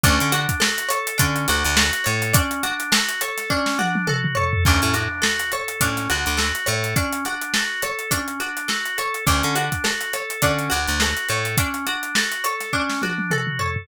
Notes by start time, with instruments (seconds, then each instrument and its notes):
0.03 electric bass (finger) D2, drawbar organ C#4, pizzicato strings D4, kick, closed hi-hat
0.20 electric bass (finger) D3, snare, closed hi-hat
0.32 drawbar organ D4, pizzicato strings F#4, closed hi-hat
0.49 kick, closed hi-hat
0.60 drawbar organ F#4, pizzicato strings A4, snare
0.78 closed hi-hat
0.89 drawbar organ A4, pizzicato strings C#5, closed hi-hat
1.07 closed hi-hat
1.18 electric bass (finger) D3, drawbar organ C#4, pizzicato strings D4, kick, closed hi-hat
1.36 closed hi-hat
1.48 electric bass (finger) D2, drawbar organ D4, pizzicato strings F#4, closed hi-hat
1.64 electric bass (finger) D2, closed hi-hat
1.77 drawbar organ F#4, pizzicato strings A4, snare
1.93 closed hi-hat
2.04 electric bass (finger) A2, drawbar organ A4, pizzicato strings C#5, closed hi-hat
2.22 closed hi-hat
2.33 drawbar organ C#4, pizzicato strings D4, kick, closed hi-hat
2.51 closed hi-hat
2.63 drawbar organ D4, pizzicato strings F#4, closed hi-hat
2.80 closed hi-hat
2.92 drawbar organ F#4, pizzicato strings A4, snare
3.09 closed hi-hat
3.21 drawbar organ A4, pizzicato strings C#5, closed hi-hat
3.38 snare, closed hi-hat
3.50 drawbar organ C#4, pizzicato strings D4, kick
3.66 snare
3.78 drawbar organ D4, pizzicato strings F#4, high tom
3.95 high tom
4.07 drawbar organ F#4, pizzicato strings A4, mid tom
4.24 mid tom
4.35 drawbar organ A4, pizzicato strings C#5, floor tom
4.53 floor tom
4.65 electric bass (finger) D2, drawbar organ C#4, pizzicato strings D4, kick, crash
4.82 electric bass (finger) A2, closed hi-hat
4.94 drawbar organ D4, pizzicato strings F#4, snare, closed hi-hat
5.22 drawbar organ F#4, pizzicato strings A4, snare
5.39 snare, closed hi-hat
5.52 drawbar organ A4, pizzicato strings C#5, closed hi-hat
5.68 closed hi-hat
5.81 electric bass (finger) A2, drawbar organ C#4, pizzicato strings D4, kick, closed hi-hat
5.97 snare, closed hi-hat
6.09 electric bass (finger) D2, drawbar organ D4, pizzicato strings F#4, closed hi-hat
6.26 electric bass (finger) D2, closed hi-hat
6.37 drawbar organ F#4, pizzicato strings A4, snare
6.55 closed hi-hat
6.66 electric bass (finger) A2, drawbar organ A4, pizzicato strings C#5, closed hi-hat
6.84 closed hi-hat
6.96 drawbar organ C#4, pizzicato strings D4, kick, closed hi-hat
7.12 closed hi-hat
7.25 drawbar organ D4, pizzicato strings F#4, closed hi-hat
7.41 closed hi-hat
7.54 drawbar organ F#4, pizzicato strings A4, snare
7.82 drawbar organ A4, pizzicato strings C#5, closed hi-hat
7.99 closed hi-hat
8.11 drawbar organ C#4, pizzicato strings D4, kick, closed hi-hat
8.28 closed hi-hat
8.40 drawbar organ D4, pizzicato strings F#4, closed hi-hat
8.57 closed hi-hat
8.68 drawbar organ F#4, pizzicato strings A4, snare
8.85 closed hi-hat
8.98 drawbar organ A4, pizzicato strings C#5, closed hi-hat
9.14 closed hi-hat
9.26 electric bass (finger) D2, drawbar organ C#4, pizzicato strings D4, kick, closed hi-hat
9.43 electric bass (finger) D3, snare, closed hi-hat
9.55 drawbar organ D4, pizzicato strings F#4, closed hi-hat
9.72 kick, closed hi-hat
9.84 drawbar organ F#4, pizzicato strings A4, snare
10.01 closed hi-hat
10.13 drawbar organ A4, pizzicato strings C#5, closed hi-hat
10.30 closed hi-hat
10.42 electric bass (finger) D3, drawbar organ C#4, pizzicato strings D4, kick, closed hi-hat
10.59 closed hi-hat
10.70 electric bass (finger) D2, drawbar organ D4, pizzicato strings F#4, closed hi-hat
10.87 electric bass (finger) D2, closed hi-hat
11.00 drawbar organ F#4, pizzicato strings A4, snare
11.17 closed hi-hat
11.28 electric bass (finger) A2, drawbar organ A4, pizzicato strings C#5, closed hi-hat
11.45 closed hi-hat
11.57 drawbar organ C#4, pizzicato strings D4, kick, closed hi-hat
11.74 closed hi-hat
11.86 drawbar organ D4, pizzicato strings F#4, closed hi-hat
12.03 closed hi-hat
12.15 drawbar organ F#4, pizzicato strings A4, snare
12.32 closed hi-hat
12.44 drawbar organ A4, pizzicato strings C#5, closed hi-hat
12.60 snare, closed hi-hat
12.73 drawbar organ C#4, pizzicato strings D4, kick
12.89 snare
13.02 drawbar organ D4, pizzicato strings F#4, high tom
13.18 high tom
13.31 drawbar organ F#4, pizzicato strings A4, mid tom
13.47 mid tom
13.59 drawbar organ A4, pizzicato strings C#5, floor tom
13.76 floor tom